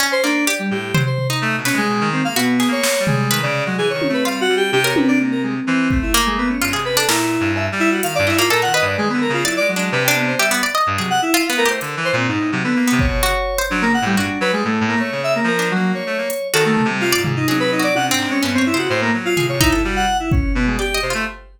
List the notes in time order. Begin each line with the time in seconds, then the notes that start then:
0.00 C#4, cowbell
0.12 C5
0.24 A#3 D4
0.47 G4 D5
0.59 G3
0.71 A2 G4
0.94 F#3 C5, floor tom
1.06 C5
1.18 floor tom
1.30 D#4
1.42 A3
1.58 B2
1.65 C#4 B4, snare
1.73 G#3
1.77 G#3
1.89 B2
2.01 D#3
2.13 C4
2.24 A#3 F5
2.36 B2 B3 F#4
2.60 G#4, snare
2.68 A#3 C#5
2.83 snare
3.00 G3
3.07 G#3, floor tom
3.31 D#3 B4, clap
3.43 C#3 D5
3.66 F#3 G#3
3.78 E3 G#4
3.90 D#3 C#5
4.02 high tom
4.09 A3
4.13 B4
4.25 G3 F4 F5
4.41 F#4
4.49 G3
4.57 G4
4.72 C3 G4, high tom
4.84 A#4 C#5
4.96 C3 B4, high tom
5.08 D4
5.20 A#3
5.31 A#4
5.43 G#3
5.67 E3 C4
5.91 A3, kick
6.02 E4
6.14 A#3
6.26 G#3
6.38 B3
6.50 C#4
6.62 G2 F4
6.73 C3 G#4
6.85 B4
6.97 D4 A4
7.09 A#2 E4 A#4, snare
7.40 G2
7.56 E5, cowbell
7.72 G3
7.80 E4
7.91 F#4
8.03 D#3 F5, closed hi-hat
8.15 G2 D5
8.27 E4 D#5, clap
8.35 G#2 A#3 F4
8.50 A#2 A4 A#4, cowbell
8.62 A#4 F#5
8.66 D#3
8.74 B4 D#5
8.82 G2
8.86 D5
8.98 D#3 G#3
9.09 D3 B3
9.21 A#4
9.29 C#3
9.33 F4
9.45 F#3 E4 D5, clap
9.57 G#3 D5
9.69 F#3
9.76 G#3 D4
9.92 C3 B4
10.04 D4 G5
10.16 B3
10.28 C5
10.39 G3 G4 E5
10.51 B3
10.63 D5
10.75 D#5
10.87 G2
10.98 C3 F#3 G#4
11.10 F#5
11.22 E4
11.34 F4
11.46 B3 F5
11.57 A3 A#4
11.65 G4 C5
11.81 D3, closed hi-hat
11.97 E3
12.05 C5
12.13 A#2 C4
12.28 G#2 D#4
12.40 A2
12.52 C3 F#3
12.64 D3 B3
12.76 A#3
12.88 B3
12.92 C3
12.99 C#5, kick
13.07 B2
13.23 C#3 F#4
13.58 C5
13.70 F#3 D4
13.82 C#3 A#3
13.94 F#5
14.02 A2 G3
14.17 G2 D4 F#4
14.41 F#3 B4
14.53 G3 G#3
14.64 A2 A3
14.81 A2
14.88 A#3
14.96 A3 C#5
15.12 C#3
15.24 E5
15.35 A#3
15.44 F3 A#4
15.59 D4
15.71 F#3
15.75 A#3
15.94 C#5
16.06 A3
16.18 A#3
16.30 closed hi-hat
16.54 D#3 F#4 A4, clap
16.65 A3
16.77 floor tom
16.85 C3
16.89 G3
17.01 F4, clap
17.13 D5
17.17 G#2
17.24 G#3, floor tom
17.36 D#4
17.48 F#3 G#4, high tom
17.60 B4
17.72 D#4
17.79 F#4
17.83 D5
17.95 C3 F#5, high tom
18.07 D4
18.11 G#2 C4
18.19 clap
18.27 G#3 C#4
18.42 G2 B3 C#4
18.54 G2 C4 C#5
18.66 E4
18.74 C#3 C5
18.78 F#4
18.89 A2 C5
19.02 A#3
19.13 F#3
19.25 F4
19.37 A2 G#4, floor tom
19.49 C3 C#5
19.61 D#4 E4, kick
19.69 G2 A4
19.84 G3 F#4
19.96 F#5
20.20 E4
20.31 C#4, kick
20.55 B2 B3
20.67 G#3
20.79 G4 D5
20.94 D#5
21.02 C3 C5
21.10 A3 F4